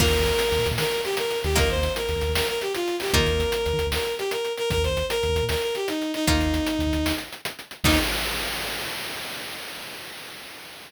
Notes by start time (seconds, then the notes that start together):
0.00 D#2 A#3 D#4 F4 A#4, kick, crash
0.07 D#2
0.13 D#2, closed hi-hat
0.20 D#2
0.26 D#2, closed hi-hat
0.39 closed hi-hat
0.52 D#2, closed hi-hat
0.59 A#2
0.66 D#2, closed hi-hat
0.71 A#2
0.78 D#3 A#4, snare
0.91 closed hi-hat
1.04 G4, closed hi-hat
1.17 A#4, closed hi-hat
1.30 closed hi-hat
1.44 D#2 G4, closed hi-hat
1.56 A#3 D#4 F4 A#4, kick, closed hi-hat
1.63 D#2
1.69 D#2 C5, closed hi-hat
1.77 D#2
1.83 D#2, closed hi-hat
1.96 A#4, closed hi-hat
2.09 D#2, closed hi-hat
2.16 D#2
2.21 D#2, closed hi-hat
2.29 D#2
2.35 D#2 A#4, snare
2.48 A#4, closed hi-hat
2.61 G4, closed hi-hat
2.75 F4, closed hi-hat
2.88 closed hi-hat
3.00 G4, open hi-hat
3.13 D#2 A#3 D#4 F4 A#4, kick, closed hi-hat
3.20 D#3
3.26 D#2, closed hi-hat
3.33 D#2
3.40 D#2, closed hi-hat
3.52 closed hi-hat
3.66 D#2, closed hi-hat
3.73 D#3
3.79 D#2, closed hi-hat
3.86 D#2
3.92 D#2 A#4, snare
4.05 closed hi-hat
4.18 G4, closed hi-hat
4.31 A#4, closed hi-hat
4.45 closed hi-hat
4.57 A#4, closed hi-hat
4.70 D#2 A#4, kick, closed hi-hat
4.77 D#2
4.84 D#2 C5, closed hi-hat
4.90 D#2
4.96 D#2, closed hi-hat
5.10 A#4, closed hi-hat
5.23 D#2, closed hi-hat
5.29 D#2
5.35 D#2, closed hi-hat
5.42 A#2
5.49 D#2 A#4, snare
5.62 A#4, closed hi-hat
5.75 G4, closed hi-hat
5.88 D#4, closed hi-hat
6.01 closed hi-hat
6.14 D#4, closed hi-hat
6.27 D#2 A#3 D#4 F4, kick, closed hi-hat
6.34 D#2
6.40 D#2, closed hi-hat
6.46 D#2
6.54 D#2, closed hi-hat
6.67 closed hi-hat
6.79 D#2, closed hi-hat
6.86 D#2
6.93 D#2, closed hi-hat
6.98 D#2
7.06 D#2, snare
7.18 closed hi-hat
7.33 closed hi-hat
7.45 closed hi-hat
7.59 closed hi-hat
7.71 closed hi-hat
7.84 D#2 A#3 D#4 F4, kick, crash